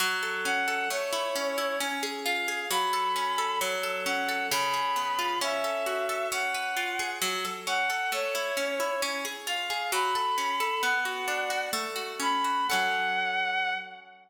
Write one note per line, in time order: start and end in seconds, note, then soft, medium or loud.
0.00 0.86 F#3 loud
0.23 0.67 A4 medium
0.45 0.88 C#4 medium
0.45 0.89 F#5 medium
0.68 0.89 A4 medium
0.90 1.76 A3 loud
0.90 1.78 C#5 medium
1.13 1.57 E4 loud
1.36 1.78 C#4 medium
1.58 1.79 E4 medium
1.80 2.66 C#4 loud
2.03 2.48 G#4 medium
2.24 2.69 F4 medium
2.24 2.69 F5 medium
2.48 2.69 G#4 medium
2.70 3.56 F#3 loud
2.70 3.59 B5 medium
2.93 3.38 A4 medium
3.16 3.59 C#4 medium
3.38 3.60 A4 loud
3.61 4.47 F#3 loud
3.83 4.28 A4 medium
4.06 4.49 C#4 medium
4.06 4.47 F#5 medium
4.29 4.50 A4 medium
4.50 5.37 C#3 loud
4.50 5.39 B5 medium
4.74 5.38 G#4 medium
4.96 5.39 B3 medium
5.19 5.40 F4 medium
5.41 6.27 C#4 loud
5.41 6.28 E5 medium
5.64 6.09 A4 medium
5.86 6.29 F#4 medium
6.09 6.31 A4 medium
6.32 7.18 C#4 loud
6.32 7.13 F#5 soft
6.55 7.19 B4 medium
6.77 7.19 F4 medium
6.99 7.21 G#4 medium
7.22 7.44 F#3 loud
7.45 7.67 A4 medium
7.67 7.90 C#4 medium
7.67 8.11 F#5 medium
7.90 8.11 A4 medium
8.12 8.35 A3 loud
8.12 9.01 C#5 medium
8.35 8.57 E4 loud
8.57 8.79 C#4 medium
8.80 9.01 E4 medium
9.02 9.25 C#4 loud
9.25 9.47 G#4 medium
9.46 9.70 F4 medium
9.46 9.91 F5 medium
9.70 9.91 G#4 medium
9.92 10.15 F#3 loud
9.92 10.81 B5 medium
10.15 10.38 A4 medium
10.38 10.60 C#4 medium
10.60 10.82 A4 loud
10.83 11.69 B3 loud
10.83 11.66 F#5 medium
11.05 11.50 F#4 medium
11.28 11.70 D4 medium
11.50 11.72 F#4 medium
11.73 12.64 A3 loud
11.96 12.44 F#4 medium
12.20 12.67 C#4 medium
12.20 12.67 B5 medium
12.44 12.69 F#4 medium
12.68 13.75 C#4 loud
12.68 13.75 A4 loud
12.68 13.73 F#5 loud
12.73 13.75 F#3 medium